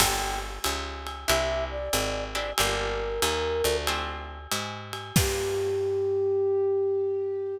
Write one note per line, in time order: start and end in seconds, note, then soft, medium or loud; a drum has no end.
0.00 0.59 G1 loud
0.00 0.51 A#3 medium
0.00 0.51 D4 medium
0.00 0.51 F4 medium
0.00 0.51 G4 loud
0.00 0.40 G5 medium
0.00 kick medium
0.00 crash loud
0.00 ride loud
0.64 1.25 C#2 loud
0.64 hi-hat pedal medium
0.64 ride medium
1.07 ride medium
1.27 1.89 C2 loud
1.27 1.79 C4 medium
1.27 1.79 D4 loud
1.27 1.79 E4 loud
1.27 1.79 G4 medium
1.27 1.65 E5 medium
1.27 ride medium
1.71 2.24 D5 medium
1.93 2.53 G#1 loud
1.93 hi-hat pedal loud
1.93 ride medium
2.34 2.51 C4 medium
2.34 2.51 D4 medium
2.34 2.51 E4 medium
2.34 2.51 G4 medium
2.34 2.52 D5 medium
2.34 ride medium
2.58 3.20 G1 loud
2.58 3.10 A#3 loud
2.58 3.10 D4 loud
2.58 3.10 F4 loud
2.58 3.10 G4 medium
2.58 3.77 A#4 loud
2.58 ride loud
3.22 3.62 D#2 loud
3.22 hi-hat pedal medium
3.22 ride medium
3.64 4.47 D2 loud
3.64 ride medium
3.87 4.39 A3 medium
3.87 4.39 C4 loud
3.87 4.39 D4 medium
3.87 4.39 F4 loud
3.87 ride medium
4.51 5.12 G#2 loud
4.51 hi-hat pedal medium
4.51 ride medium
4.93 ride medium
5.16 7.57 G2 loud
5.16 7.57 A#3 loud
5.16 7.57 D4 loud
5.16 7.57 F4 loud
5.16 7.57 G4 loud
5.16 7.58 G4 loud
5.16 kick loud
5.16 crash loud